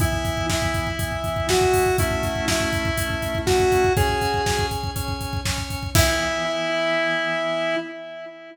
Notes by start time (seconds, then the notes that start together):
0.00 E3 B3 E4, kick, closed hi-hat
0.12 kick
0.25 kick, closed hi-hat
0.37 kick
0.50 E4, kick, snare
0.62 kick
0.74 kick, closed hi-hat
0.87 kick
0.99 E3 B3 E4, kick, closed hi-hat
1.12 kick
1.24 kick, closed hi-hat
1.36 kick
1.49 F#4, kick, snare
1.61 kick
1.74 kick, open hi-hat
1.86 kick
1.98 A3 C#4 E4, kick, closed hi-hat
2.11 kick
2.23 kick, closed hi-hat
2.36 kick
2.48 E4, kick, snare
2.60 kick
2.73 kick, closed hi-hat
2.85 kick
2.98 A3 C#4 E4, kick, closed hi-hat
3.10 kick
3.22 kick, closed hi-hat
3.35 kick
3.46 F#4, kick, snare
3.60 kick
3.72 kick, closed hi-hat
3.84 kick
3.97 C#4 G#4 C#5 G#5, kick, closed hi-hat
4.09 kick
4.21 kick, closed hi-hat
4.34 kick
4.46 C#4 C#5 G#5, kick, snare
4.59 kick
4.71 kick, closed hi-hat
4.83 kick
4.96 C#4 C#5 G#5, kick, closed hi-hat
5.08 kick
5.21 kick, closed hi-hat
5.33 kick
5.45 C#4 C#5 G#5, kick, snare
5.58 kick
5.70 kick, closed hi-hat
5.83 kick
5.95 E3 B3 E4, kick, crash